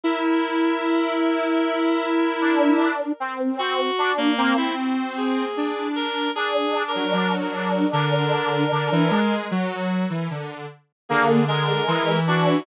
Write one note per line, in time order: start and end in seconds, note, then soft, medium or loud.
0.03 2.88 E4 loud
0.03 2.88 A#4 medium
2.41 3.12 D4 medium
3.20 3.91 C4 medium
3.59 4.12 F#4 loud
3.98 4.34 D4 medium
4.18 4.53 A#3 loud
4.37 4.56 A#3 medium
4.37 5.44 C4 medium
4.57 4.75 E4 medium
5.17 5.88 G#4 medium
5.57 6.28 D4 medium
5.96 6.31 A#4 loud
6.35 9.20 D4 medium
6.35 6.83 G#4 loud
6.88 7.35 A#4 medium
6.95 7.13 F#3 medium
7.13 7.84 F#3 medium
7.40 7.88 A#4 medium
7.93 8.64 D3 loud
7.93 9.35 A#4 medium
8.72 8.89 D3 medium
8.92 9.10 E3 loud
9.11 9.46 G#3 loud
9.51 10.04 F#3 loud
10.10 10.27 E3 medium
10.30 10.66 D3 medium
11.09 11.81 D3 medium
11.09 11.45 A#3 medium
11.09 11.44 G#4 medium
11.48 12.19 G#3 medium
11.48 12.19 A#4 loud
11.88 12.59 E3 loud
12.27 12.63 D4 medium
12.27 12.63 F#4 medium